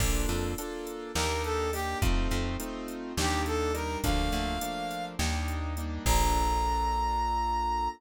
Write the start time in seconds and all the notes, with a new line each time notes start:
0.00 A#1 A#3 D4 F4 A4, kick, crash
0.29 F2, closed hi-hat
0.58 A#3 D4 F4 A4, closed hi-hat
0.87 closed hi-hat
1.14 D#2 A#3 D4 D#4 G4 A#4, snare
1.44 A4, closed hi-hat
1.73 A#3 D4 D#4 G4, open hi-hat
2.02 F2 A3 C4 D#4 F4, kick, closed hi-hat
2.31 F2, closed hi-hat
2.60 A3 C4 D#4 F4, closed hi-hat
2.88 closed hi-hat
3.17 D#2 G3 A#3 D4 D#4 G4, snare
3.46 A4, closed hi-hat
3.74 G3 A#3 D4 D#4 A#4, closed hi-hat
4.04 D2 F3 A3 A#3 D4 F5, kick, closed hi-hat
4.32 D2, closed hi-hat
4.61 F3 A3 A#3 D4, closed hi-hat
4.91 closed hi-hat
5.19 D#2 G3 A#3 D4 D#4, snare
5.48 closed hi-hat
5.77 G3 A#3 D4 D#4, closed hi-hat
6.06 A#1 A#3 D4 F4 A4 A#5, kick, crash